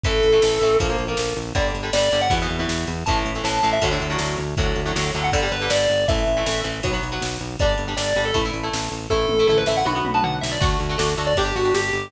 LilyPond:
<<
  \new Staff \with { instrumentName = "Distortion Guitar" } { \time 4/4 \key d \major \tempo 4 = 159 a'2 r2 | d''16 r8. d''8. fis''16 r2 | a''16 r8. a''8. e''16 r2 | r4. r16 fis''16 d''8 b'8 d''4 |
e''4. r2 r8 | d''16 r8. d''8. a'16 r2 | a'4 a'16 b'16 e''16 fis''16 b''8 r16 a''16 fis''16 r16 e''16 d''16 | r4. r16 d''16 g'8 fis'8 g'4 | }
  \new Staff \with { instrumentName = "Overdriven Guitar" } { \time 4/4 \key d \major <e a>8. <e a>16 <e a>8 <e a>8 <f bes>16 <f bes>8 <f bes>4~ <f bes>16 | <d g>8. <d g>16 <d g>8 <d g>8 <b, e>16 <b, e>8 <b, e>4~ <b, e>16 | <a, e>8. <a, e>16 <a, e>8 <a, e>8 <a, d fis>16 <a, d fis>8 <a, d fis>4~ <a, d fis>16 | <a, d fis>8. <a, d fis>16 <a, d fis>8 <a, d fis>8 <d g>16 <d g>8 <d g>4~ <d g>16 |
<e a>8. <e a>16 <e a>8 <e a>8 <fis b>16 <fis b>8 <fis b>4~ <fis b>16 | <g d'>8. <g d'>16 <g d'>8 <g d'>8 <a e'>16 <a e'>8 <a e'>4~ <a e'>16 | <a e'>8. <a e'>16 <a e'>8 <a e'>8 <b fis'>16 <b fis'>8 <b fis'>4~ <b fis'>16 | <a d' fis'>8. <a d' fis'>16 <a d' fis'>8 <a d' fis'>8 <d' g'>16 <d' g'>8 <d' g'>4~ <d' g'>16 | }
  \new Staff \with { instrumentName = "Synth Bass 1" } { \clef bass \time 4/4 \key d \major a,,8 a,,8 a,,8 a,,8 bes,,8 bes,,8 bes,,8 bes,,8 | g,,8 g,,8 g,,8 g,,8 e,8 e,8 e,8 e,8 | a,,8 a,,8 a,,8 a,,8 d,8 d,8 d,8 d,8 | d,8 d,8 d,8 d,8 g,,8 g,,8 g,,8 g,,8 |
a,,8 a,,8 a,,8 a,,8 b,,8 b,,8 b,,8 b,,8 | g,,8 g,,8 g,,8 g,,8 a,,8 a,,8 a,,8 a,,8 | a,,8 a,,8 a,,8 a,,8 b,,8 b,,8 b,,8 b,,8 | d,8 d,8 d,8 d,8 g,,8 g,,8 g,,8 g,,8 | }
  \new DrumStaff \with { instrumentName = "Drums" } \drummode { \time 4/4 <bd cymr>8 cymr8 sn8 cymr8 <bd cymr>8 cymr8 sn8 cymr8 | <bd cymr>8 cymr8 sn8 cymr8 <bd cymr>8 cymr8 sn8 cymr8 | <bd cymr>8 cymr8 sn8 cymr8 <bd cymr>8 cymr8 sn8 cymr8 | <bd cymr>8 cymr8 sn8 cymr8 <bd cymr>8 cymr8 sn8 cymr8 |
<bd cymr>8 cymr8 sn8 cymr8 <bd cymr>8 cymr8 sn8 cymr8 | <bd cymr>8 cymr8 sn8 cymr8 <bd cymr>8 cymr8 sn8 cymr8 | bd8 toml8 tomfh8 sn8 tommh8 toml8 tomfh8 sn8 | <cymc bd>8 cymr8 sn8 cymr8 <bd cymr>8 cymr8 sn8 cymr8 | }
>>